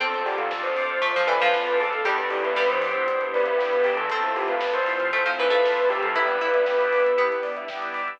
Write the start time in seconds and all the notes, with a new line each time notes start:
0.00 D2 C4 D4 F4 A4, kick, closed hi-hat
0.12 C5, closed hi-hat
0.26 G4 D5, open hi-hat
0.37 D3 A4 F5, closed hi-hat
0.51 C4 D4 F4 A4 A5, kick, snare
0.63 D2 C5 C6, closed hi-hat
0.76 D6, open hi-hat
0.89 D2 F6, closed hi-hat
1.01 A3 C4 D4 F4 A4, kick, closed hi-hat
1.14 D2 F3 C5, closed hi-hat
1.27 E3 B4 D5, open hi-hat
1.40 F3 F5, closed hi-hat
1.53 C4 D4 F4 A4 A5, kick, snare
1.67 A2 C6, closed hi-hat
1.80 A4 D6, open hi-hat
1.92 A2 A4 F6, closed hi-hat
2.05 E2 G3 B3 D4 E4 G4 A4, kick, closed hi-hat
2.18 B4, closed hi-hat
2.30 G4 D5, open hi-hat
2.43 E2 B4 E5, closed hi-hat
2.56 G3 B3 D4 E4 G4 G5, kick, snare
2.69 E3 C5 B5, closed hi-hat
2.82 D6, open hi-hat
2.94 B2 E6, closed hi-hat
3.07 B3 D4 E4 G4, kick, closed hi-hat
3.21 E2 B4, closed hi-hat
3.34 B4 D5, open hi-hat
3.46 E5, closed hi-hat
3.58 B3 D4 E4 G4 G5, kick, snare
3.72 B2 B5, closed hi-hat
3.84 G4 D6, open hi-hat
3.97 E3 A4 E6, closed hi-hat
4.10 F2 A3 C4 E4 F4 A4, kick, closed hi-hat
4.23 C5, closed hi-hat
4.36 G4 E5, open hi-hat
4.48 F2 B4 F5, closed hi-hat
4.61 A3 C4 E4 F4 A5, kick, snare
4.74 F2 C5 C6, closed hi-hat
4.86 E6, open hi-hat
5.00 C3 F6, closed hi-hat
5.12 A3 C4 E4 F4 A4, kick, closed hi-hat
5.26 F2 F3 C5, closed hi-hat
5.39 E3 B4 E5, open hi-hat
5.50 A3 F5, closed hi-hat
5.63 A3 C4 E4 F4 A5, kick, snare
5.76 F2 C6, closed hi-hat
5.90 G4 E6, open hi-hat
6.02 F3 A4 F6, closed hi-hat
6.14 G1 G3 B3 D4 E4 G4 B4, kick, closed hi-hat
6.28 B4, closed hi-hat
6.40 E4 D5, open hi-hat
6.54 G1 E5, closed hi-hat
6.66 G3 B3 D4 E4 G5, kick, snare
6.79 G1 B5, closed hi-hat
6.91 D6, open hi-hat
7.04 G1 E6, closed hi-hat
7.17 G3 B3 D4 E4 G4, kick, closed hi-hat
7.31 G1 B4, closed hi-hat
7.43 D5, open hi-hat
7.57 E5, closed hi-hat
7.68 G3 B3 D4 E4 G5, kick, snare
7.82 G1 B5, closed hi-hat
7.94 D6, open hi-hat
8.07 G2 E6, closed hi-hat